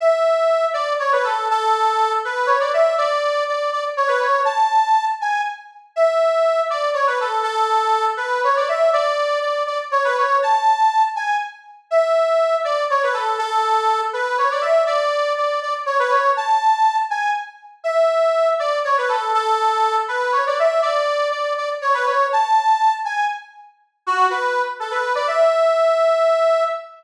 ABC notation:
X:1
M:3/4
L:1/16
Q:1/4=121
K:Emix
V:1 name="Accordion"
e6 d2 c B A2 | A6 B2 c d e2 | d4 d2 d z c B c2 | a6 g2 z4 |
e6 d2 c B A2 | A6 B2 c d e2 | d4 d2 d z c B c2 | a6 g2 z4 |
e6 d2 c B A2 | A6 B2 c d e2 | d4 d2 d z c B c2 | a6 g2 z4 |
e6 d2 c B A2 | A6 B2 c d e2 | d4 d2 d z c B c2 | a6 g2 z4 |
z2 F2 B3 z A B2 d | e12 |]